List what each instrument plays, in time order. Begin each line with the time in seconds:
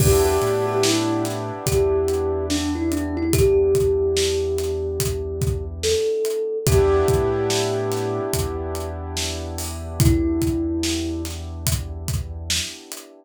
0.00 synth bass 2 E2, acoustic grand piano B3 D4 E4 G4, kalimba G4, kick, crash
0.25 kalimba G4
0.42 synth bass 2 A2, closed hi-hat
0.67 kalimba G4
0.83 kalimba E4, snare
1.25 snare, closed hi-hat
1.66 synth bass 2 E2, kalimba G4, kick, closed hi-hat
2.08 closed hi-hat
2.50 kalimba D4, snare
2.75 kalimba E4
2.92 kalimba D4, closed hi-hat
3.17 kalimba E4
3.33 kalimba G4, kick, closed hi-hat
3.75 kick, closed hi-hat
4.17 snare
4.58 snare, closed hi-hat
5.00 kick, closed hi-hat
5.41 kick, closed hi-hat
5.83 kalimba A4, snare
6.25 closed hi-hat
6.66 synth bass 2 E2, acoustic grand piano B3 D4 E4 G4, kalimba G4, kick, closed hi-hat
7.08 synth bass 2 A2, kick, closed hi-hat
7.50 snare
7.92 snare, closed hi-hat
8.33 synth bass 2 E2, kick, closed hi-hat
8.75 closed hi-hat
9.17 snare
9.58 open hi-hat
10.00 kalimba E4, kick, closed hi-hat
10.42 kick, closed hi-hat
10.83 snare
11.25 snare, closed hi-hat
11.67 kick, closed hi-hat
12.08 kick, closed hi-hat
12.50 snare
12.92 closed hi-hat